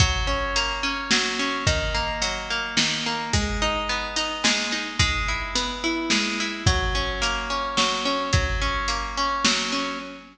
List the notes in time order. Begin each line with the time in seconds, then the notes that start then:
0.00 F#3, kick, closed hi-hat
0.27 C#4
0.56 A#3, closed hi-hat
0.83 C#4
1.11 F#3, snare
1.39 C#4
1.67 D#3, kick, closed hi-hat
1.94 A#3
2.22 F#3, closed hi-hat
2.50 A#3
2.77 D#3, snare
3.06 A#3
3.33 G#3, kick, closed hi-hat
3.62 D#4
3.89 B3
4.16 D#4, closed hi-hat
4.44 G#3, snare
4.72 D#4
4.99 G#3, kick, closed hi-hat
5.28 E4
5.55 B3, closed hi-hat
5.84 E4
6.10 G#3, snare
6.40 E4
6.66 F#3, kick, closed hi-hat
6.95 C#4
7.22 A#3, closed hi-hat
7.50 C#4
7.77 F#3, snare
8.05 C#4
8.33 F#3, kick, closed hi-hat
8.61 C#4
8.88 A#3, closed hi-hat
9.17 C#4
9.45 F#3, snare
9.72 C#4